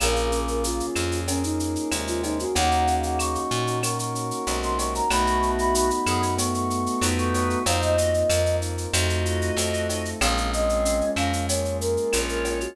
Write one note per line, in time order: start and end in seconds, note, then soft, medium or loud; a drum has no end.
0.00 0.82 A#1 medium
0.00 0.87 C#3 medium
0.00 0.87 A#3 medium
0.00 1.28 A#3 loud
0.00 1.27 A#3 medium
0.00 1.27 C#4 medium
0.00 1.27 F4 medium
0.00 1.27 G#4 medium
0.00 0.39 A#4 loud
0.00 cowbell medium
0.00 claves loud
0.00 shaker loud
0.16 shaker medium
0.32 1.59 C#4 medium
0.32 shaker medium
0.48 0.63 A#4 medium
0.48 shaker medium
0.64 1.90 F4 medium
0.64 1.20 F4 loud
0.64 shaker medium
0.80 shaker medium
0.95 1.77 F2 medium
0.95 2.22 G#4 medium
0.95 claves medium
0.95 shaker medium
1.12 shaker medium
1.28 2.54 A#3 medium
1.28 2.50 A#3 medium
1.28 1.43 C#4 loud
1.28 2.54 C#4 medium
1.28 2.54 G#4 medium
1.28 2.54 A#4 medium
1.28 cowbell medium
1.28 shaker medium
1.43 1.94 D#4 medium
1.43 shaker medium
1.59 2.50 C#4 medium
1.59 shaker medium
1.76 shaker medium
1.91 2.46 D#2 medium
1.91 2.44 C3 medium
1.91 2.44 G#3 medium
1.91 2.51 F4 medium
1.91 cowbell medium
1.91 claves medium
1.91 shaker medium
2.07 2.22 F4 medium
2.07 shaker medium
2.23 2.38 D#4 medium
2.23 2.53 G#4 medium
2.23 cowbell medium
2.23 shaker medium
2.39 2.55 F#4 medium
2.39 shaker medium
2.55 3.37 D#2 loud
2.55 3.40 C#3 medium
2.55 3.83 A#3 loud
2.55 3.40 A#3 medium
2.55 3.82 A#3 medium
2.55 3.82 C#4 medium
2.55 3.82 D#4 medium
2.55 3.82 F#4 medium
2.55 2.95 F#5 loud
2.55 cowbell medium
2.55 shaker medium
2.71 shaker medium
2.87 4.14 C#4 medium
2.87 shaker medium
3.03 3.18 F#5 medium
3.03 shaker medium
3.19 4.46 D#4 medium
3.19 3.79 C#6 medium
3.19 claves medium
3.19 shaker medium
3.35 shaker medium
3.51 4.32 A#2 medium
3.51 4.77 F#4 medium
3.51 shaker medium
3.67 shaker medium
3.82 5.09 A#3 medium
3.82 5.05 A#3 medium
3.82 5.09 C#4 medium
3.82 5.09 F#4 medium
3.82 5.09 A#4 medium
3.82 3.98 C#6 medium
3.82 cowbell medium
3.82 claves medium
3.82 shaker medium
3.99 4.60 C#6 medium
3.99 shaker medium
4.14 5.05 C#4 medium
4.14 shaker medium
4.31 shaker medium
4.47 5.01 B1 medium
4.47 5.02 C3 medium
4.47 5.02 G#3 medium
4.47 5.07 D#4 medium
4.47 cowbell medium
4.47 shaker medium
4.63 4.78 C6 medium
4.63 shaker medium
4.78 5.08 F#4 medium
4.78 4.94 C#6 medium
4.78 cowbell medium
4.78 shaker medium
4.95 5.10 A#5 medium
4.95 shaker medium
5.10 5.92 B1 medium
5.10 6.37 A3 medium
5.10 6.38 A3 loud
5.10 5.90 A3 medium
5.10 6.37 B3 medium
5.10 6.37 D#4 medium
5.10 6.37 F#4 medium
5.10 5.90 F#4 medium
5.10 5.51 B5 loud
5.10 cowbell medium
5.10 claves medium
5.10 shaker medium
5.27 shaker medium
5.41 6.69 B3 medium
5.41 shaker medium
5.59 5.74 B5 medium
5.59 shaker medium
5.74 7.02 D#4 medium
5.74 6.35 B5 medium
5.74 shaker loud
5.90 shaker medium
6.06 6.88 F#2 medium
6.06 6.22 B3 medium
6.06 7.34 F#4 medium
6.06 6.22 G#4 medium
6.06 claves medium
6.06 shaker medium
6.22 shaker medium
6.37 7.63 A3 medium
6.37 7.60 A3 medium
6.37 7.63 B3 medium
6.37 7.63 F#4 medium
6.37 7.63 A4 medium
6.37 6.54 C#6 medium
6.37 cowbell medium
6.37 shaker loud
6.54 7.06 C#6 loud
6.54 shaker medium
6.69 7.60 B3 medium
6.69 shaker medium
6.86 shaker medium
7.01 7.56 F2 medium
7.01 7.59 D#4 medium
7.01 7.63 D#4 medium
7.01 7.59 B4 medium
7.01 cowbell medium
7.01 claves medium
7.01 shaker loud
7.18 7.33 C#6 medium
7.18 shaker medium
7.34 7.64 F#4 medium
7.34 7.49 C#6 loud
7.34 cowbell medium
7.34 shaker medium
7.50 7.65 C#6 medium
7.50 shaker medium
7.66 8.24 F2 medium
7.66 8.29 A#3 medium
7.66 8.30 A#3 loud
7.66 8.29 C4 medium
7.66 8.29 D#4 medium
7.66 7.96 D#4 medium
7.66 8.29 F4 medium
7.66 7.96 C5 medium
7.66 7.81 F5 medium
7.66 cowbell medium
7.66 shaker medium
7.82 8.56 D#5 medium
7.82 shaker medium
7.97 8.88 F4 medium
7.97 8.13 F#4 medium
7.97 8.13 D#5 medium
7.97 shaker medium
8.14 shaker medium
8.29 8.87 F2 medium
8.29 8.93 A#3 medium
8.29 8.91 A#3 medium
8.29 8.92 C4 medium
8.29 8.92 F4 medium
8.29 8.93 A#4 medium
8.29 claves medium
8.29 shaker medium
8.46 shaker medium
8.61 8.91 D#4 medium
8.61 shaker medium
8.78 shaker medium
8.92 9.51 F2 loud
8.92 9.56 A3 medium
8.92 9.58 A3 loud
8.92 9.56 C4 medium
8.92 9.56 D#4 medium
8.92 9.56 F4 medium
8.92 10.09 F#4 medium
8.92 10.09 D#5 medium
8.92 cowbell medium
8.92 claves medium
8.92 shaker loud
9.10 shaker medium
9.25 10.16 F4 medium
9.25 shaker medium
9.41 shaker medium
9.57 10.14 F2 medium
9.57 10.20 A3 medium
9.57 10.19 A3 medium
9.57 10.20 C4 medium
9.57 10.20 F4 medium
9.57 10.20 A4 medium
9.57 cowbell medium
9.57 shaker medium
9.73 shaker medium
9.89 10.20 D#4 medium
9.89 cowbell medium
9.89 shaker medium
10.05 shaker medium
10.21 11.02 A#1 loud
10.21 11.49 G#3 loud
10.21 11.48 G#3 medium
10.21 11.48 A#3 medium
10.21 11.06 C4 medium
10.21 11.48 C#4 medium
10.21 11.48 F4 medium
10.21 11.06 G#4 medium
10.21 10.51 F5 medium
10.21 cowbell medium
10.21 claves medium
10.21 shaker medium
10.37 shaker medium
10.52 11.80 A#3 medium
10.52 11.11 D#5 medium
10.52 shaker medium
10.69 shaker medium
10.85 12.13 C#4 medium
10.85 shaker medium
11.01 shaker soft
11.16 11.98 F2 medium
11.16 11.32 C#4 medium
11.16 12.45 F4 medium
11.16 11.32 A#4 medium
11.16 11.46 F5 medium
11.16 claves medium
11.16 shaker medium
11.33 shaker medium
11.49 12.70 G#3 medium
11.49 12.76 G#3 medium
11.49 12.76 A#3 medium
11.49 12.76 F4 medium
11.49 12.76 G#4 medium
11.49 11.77 C#5 medium
11.49 cowbell medium
11.49 shaker medium
11.65 shaker medium
11.80 12.71 A#3 medium
11.80 12.20 A#4 loud
11.80 shaker medium
11.97 shaker medium
12.13 12.68 A#1 medium
12.13 12.74 C#4 medium
12.13 12.74 F4 medium
12.13 12.74 C#5 medium
12.13 cowbell medium
12.13 claves medium
12.13 shaker loud
12.28 12.58 A#4 medium
12.28 shaker medium
12.45 12.75 F4 medium
12.45 cowbell medium
12.45 shaker medium
12.61 12.76 F#4 medium
12.61 shaker medium